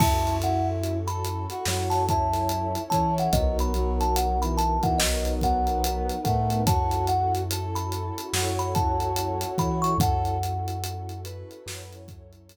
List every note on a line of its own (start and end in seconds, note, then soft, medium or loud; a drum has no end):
0.00 1.47 F#2 medium
0.00 1.65 C#4 medium
0.00 0.39 C#4 loud
0.00 1.65 E4 medium
0.00 0.38 E4 medium
0.00 1.65 F#4 medium
0.00 1.65 A4 loud
0.00 0.35 A5 medium
0.00 kick loud
0.00 crash loud
0.27 closed hi-hat medium
0.41 0.98 E4 medium
0.41 0.68 F#5 medium
0.41 closed hi-hat medium
0.84 closed hi-hat medium
1.07 1.46 A4 medium
1.07 1.80 B5 medium
1.07 closed hi-hat medium
1.25 closed hi-hat medium
1.50 1.65 F#4 medium
1.50 closed hi-hat medium
1.65 2.76 F#2 medium
1.65 2.78 F#3 medium
1.65 3.32 C#4 loud
1.65 3.32 E4 loud
1.65 2.03 F#4 medium
1.65 3.32 A4 medium
1.65 3.32 C#5 medium
1.65 snare loud
1.90 2.05 A5 medium
1.90 snare soft
1.90 closed hi-hat medium
2.09 2.83 E4 medium
2.09 2.81 A5 medium
2.09 kick medium
2.09 closed hi-hat medium
2.34 snare soft
2.34 closed hi-hat medium
2.49 closed hi-hat loud
2.75 closed hi-hat medium
2.90 3.28 E3 medium
2.90 3.32 C#4 medium
2.90 3.28 E4 medium
2.90 3.14 A5 medium
2.90 kick medium
2.90 closed hi-hat medium
3.18 3.35 F#5 medium
3.18 closed hi-hat medium
3.33 4.79 B1 loud
3.33 3.74 F#3 medium
3.33 4.99 B3 loud
3.33 3.72 B3 loud
3.33 4.99 D#4 medium
3.33 4.99 F#4 loud
3.33 4.99 A#4 loud
3.33 3.57 D#5 medium
3.33 kick loud
3.33 closed hi-hat loud
3.59 3.94 B5 medium
3.59 closed hi-hat medium
3.74 4.38 F#3 medium
3.74 closed hi-hat medium
4.01 4.16 A5 medium
4.01 closed hi-hat medium
4.16 4.40 F#5 medium
4.16 closed hi-hat loud
4.42 4.77 E3 medium
4.42 4.57 B5 medium
4.42 closed hi-hat medium
4.57 4.82 A5 medium
4.57 closed hi-hat loud
4.83 4.98 E3 medium
4.83 4.99 F#5 medium
4.83 kick loud
4.83 closed hi-hat medium
4.98 6.10 B1 medium
4.98 5.39 F#3 medium
4.98 6.10 B3 medium
4.98 6.65 B3 medium
4.98 6.65 D#4 loud
4.98 6.65 A#4 loud
4.98 6.65 B4 medium
4.98 5.34 D#5 medium
4.98 snare loud
5.25 closed hi-hat medium
5.41 6.16 F#3 medium
5.41 6.21 F#5 medium
5.41 kick medium
5.41 closed hi-hat medium
5.67 closed hi-hat medium
5.84 closed hi-hat loud
6.10 closed hi-hat medium
6.24 6.63 A2 medium
6.24 6.61 A3 medium
6.24 6.63 F#5 medium
6.24 kick medium
6.24 closed hi-hat medium
6.50 closed hi-hat medium
6.66 8.11 F#2 medium
6.66 7.05 C#4 loud
6.66 8.32 C#4 loud
6.66 8.32 E4 loud
6.66 7.42 F#4 medium
6.66 8.32 F#4 medium
6.66 8.32 A4 loud
6.66 7.07 A5 medium
6.66 kick loud
6.66 closed hi-hat loud
6.91 closed hi-hat medium
7.07 7.33 F#5 medium
7.07 closed hi-hat medium
7.35 closed hi-hat medium
7.50 8.25 A4 medium
7.50 closed hi-hat loud
7.75 8.49 B5 medium
7.75 closed hi-hat medium
7.92 closed hi-hat medium
8.18 closed hi-hat medium
8.33 9.44 F#2 medium
8.33 9.45 F#3 medium
8.33 9.98 C#4 medium
8.33 9.98 E4 loud
8.33 9.93 F#4 medium
8.33 9.98 A4 loud
8.33 9.98 C#5 medium
8.33 snare loud
8.59 8.74 B5 medium
8.59 closed hi-hat medium
8.75 9.50 A5 medium
8.75 kick loud
8.75 closed hi-hat medium
9.00 closed hi-hat medium
9.16 closed hi-hat loud
9.41 closed hi-hat loud
9.58 9.94 E3 medium
9.58 9.95 E4 medium
9.58 9.83 B5 medium
9.58 kick medium
9.58 closed hi-hat medium
9.82 9.97 C#6 medium
9.82 closed hi-hat medium
9.98 11.44 F#2 loud
9.98 10.38 C#4 loud
9.98 11.65 C#4 medium
9.98 11.65 E4 loud
9.98 11.65 F#4 loud
9.98 11.65 A4 loud
9.98 10.36 A4 medium
9.98 11.20 F#5 medium
9.98 kick loud
9.98 closed hi-hat loud
10.25 closed hi-hat medium
10.43 closed hi-hat loud
10.68 closed hi-hat medium
10.84 closed hi-hat loud
11.09 closed hi-hat medium
11.24 12.00 B4 medium
11.24 closed hi-hat loud
11.51 closed hi-hat medium
11.66 12.56 F#2 medium
11.66 12.56 F#3 medium
11.66 12.56 C#4 loud
11.66 12.56 E4 loud
11.66 12.56 A4 medium
11.66 12.56 C#5 medium
11.66 snare loud
11.93 closed hi-hat medium
12.08 kick loud
12.08 closed hi-hat medium
12.33 closed hi-hat medium
12.49 closed hi-hat loud